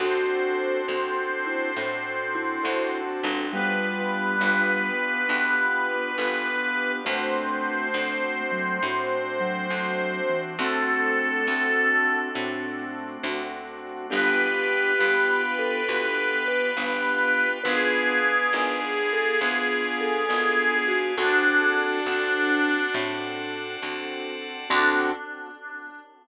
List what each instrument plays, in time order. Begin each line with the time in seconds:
0.00 electric bass (finger) D2, acoustic grand piano C4 D4 F#4 A4, drawbar organ C4 D4 F#4 A4, vibraphone F#4, harmonica C5
0.88 electric bass (finger) D2, acoustic grand piano C4 D4 F#4 A4
1.46 vibraphone E4
1.76 electric bass (finger) A2, acoustic grand piano C4 D4 F#4 A4
2.35 vibraphone E4
2.63 electric bass (finger) D2, acoustic grand piano C4 D4 F#4 A4
3.23 electric bass (finger) G1, vibraphone D4
3.53 vibraphone G3, acoustic grand piano B3 D4 F4 G4, drawbar organ B3 D4 F4 G4, harmonica B4
4.41 electric bass (finger) G1, acoustic grand piano B3 D4 F4 G4
5.28 electric bass (finger) D2, acoustic grand piano B3 D4 F4 G4
6.18 electric bass (finger) G1, acoustic grand piano B3 D4 F4 G4
7.05 electric bass (finger) D2, acoustic grand piano A3 C4 D4 F#4, drawbar organ A3 C4 D4 F#4, vibraphone A3, harmonica C5
7.94 electric bass (finger) D2, acoustic grand piano A3 C4 D4 F#4
8.51 vibraphone F#3
8.83 electric bass (finger) A2, acoustic grand piano A3 C4 D4 F#4
9.40 vibraphone F#3
9.70 electric bass (finger) D2, acoustic grand piano A3 C4 D4 F#4
10.29 vibraphone E3
10.58 electric bass (finger) D2, acoustic grand piano A3 C4 D4 F#4, drawbar organ A3 C4 D4 F#4, vibraphone C4, harmonica A4
11.47 electric bass (finger) D2, acoustic grand piano A3 C4 D4 F#4
12.35 electric bass (finger) A2, acoustic grand piano A3 C4 D4 F#4
13.23 electric bass (finger) D2, acoustic grand piano A3 C4 D4 F#4
14.10 electric bass (finger) G1, acoustic grand piano B3 D4 F4 G4, vibraphone G4, drawbar organ B4 D5 F5 G5, harmonica B4
14.99 electric bass (finger) G1, acoustic grand piano B3 D4 F4 G4
15.59 vibraphone A4
15.88 electric bass (finger) D2, acoustic grand piano B3 D4 F4 G4
16.48 vibraphone B4
16.77 electric bass (finger) G1, acoustic grand piano B3 D4 F4 G4
17.64 electric bass (finger) G#1, acoustic grand piano B3 D4 F4 G#4, harmonica G#4, vibraphone B4, drawbar organ B4 D5 F5 G#5
18.53 electric bass (finger) G#1, acoustic grand piano B3 D4 F4 G#4
19.13 vibraphone A4
19.41 electric bass (finger) D2, acoustic grand piano B3 D4 F4 G#4
20.01 vibraphone A4
20.29 electric bass (finger) G#1, acoustic grand piano B3 D4 F4 G#4
20.88 vibraphone F#4
21.17 electric bass (finger) D2, acoustic grand piano C4 D4 F#4 A4, harmonica D4, vibraphone F#4, drawbar organ C5 D5 F#5 A5
22.06 electric bass (finger) D2, acoustic grand piano C4 D4 F#4 A4
22.94 electric bass (finger) A2, acoustic grand piano C4 D4 F#4 A4
23.83 electric bass (finger) D2, acoustic grand piano C4 D4 F#4 A4
24.70 electric bass (finger) D2, acoustic grand piano C4 D4 F#4 A4, drawbar organ C4 D4 F#4 A4, vibraphone D4, harmonica D4